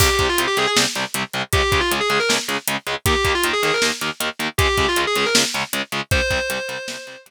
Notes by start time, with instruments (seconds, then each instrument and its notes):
0.00 overdriven guitar C2 C3 G3, distortion guitar G4, kick, crash
0.19 overdriven guitar C2 C3 G3, kick, closed hi-hat
0.29 distortion guitar F4
0.38 overdriven guitar C2 C3 G3, closed hi-hat
0.47 distortion guitar G4
0.57 overdriven guitar C2 C3 G3, distortion guitar G#4, closed hi-hat
0.67 distortion guitar G#4
0.77 overdriven guitar C2 C3 G3, snare
0.95 overdriven guitar C2 C3 G3, closed hi-hat
1.14 overdriven guitar C2 C3 G3, closed hi-hat
1.33 overdriven guitar C2 C3 G3, closed hi-hat
1.53 overdriven guitar C#2 C#3 G#3, distortion guitar G4, kick, closed hi-hat
1.72 overdriven guitar C#2 C#3 G#3, kick, closed hi-hat
1.80 distortion guitar F4
1.91 overdriven guitar C#2 C#3 G#3, closed hi-hat
2.00 distortion guitar G#4
2.09 overdriven guitar C#2 C#3 G#3, distortion guitar G#4, closed hi-hat
2.20 distortion guitar A#4
2.29 overdriven guitar C#2 C#3 G#3, snare
2.48 overdriven guitar C#2 C#3 G#3, closed hi-hat
2.68 overdriven guitar C#2 C#3 G#3, closed hi-hat
2.87 overdriven guitar C#2 C#3 G#3, closed hi-hat
3.06 overdriven guitar D#2 D#3 A#3, distortion guitar G4, kick, closed hi-hat
3.25 overdriven guitar D#2 D#3 A#3, kick, closed hi-hat
3.35 distortion guitar F4
3.43 overdriven guitar D#2 D#3 A#3, closed hi-hat
3.53 distortion guitar G#4
3.63 overdriven guitar D#2 D#3 A#3, distortion guitar G#4, closed hi-hat
3.73 distortion guitar A#4
3.82 overdriven guitar D#2 D#3 A#3, snare
4.01 overdriven guitar D#2 D#3 A#3, closed hi-hat
4.20 overdriven guitar D#2 D#3 A#3, closed hi-hat
4.39 overdriven guitar D#2 D#3 A#3, closed hi-hat
4.58 overdriven guitar C#2 C#3 G#3, distortion guitar G4, kick, closed hi-hat
4.77 overdriven guitar C#2 C#3 G#3, kick, closed hi-hat
4.88 distortion guitar F4
4.96 overdriven guitar C#2 C#3 G#3, closed hi-hat
5.07 distortion guitar G#4
5.15 overdriven guitar C#2 C#3 G#3, distortion guitar G#4, closed hi-hat
5.26 distortion guitar A#4
5.35 overdriven guitar C#2 C#3 G#3, snare
5.54 overdriven guitar C#2 C#3 G#3, closed hi-hat
5.73 overdriven guitar C#2 C#3 G#3, closed hi-hat
5.92 overdriven guitar C#2 C#3 G#3, closed hi-hat
6.11 overdriven guitar C2 C3 G3, distortion guitar C5, kick, closed hi-hat
6.30 overdriven guitar C2 C3 G3, kick, closed hi-hat
6.50 overdriven guitar C2 C3 G3, closed hi-hat
6.69 overdriven guitar C2 C3 G3, closed hi-hat
6.88 overdriven guitar C2 C3 G3, snare
7.07 overdriven guitar C2 C3 G3, closed hi-hat
7.26 overdriven guitar C2 C3 G3, closed hi-hat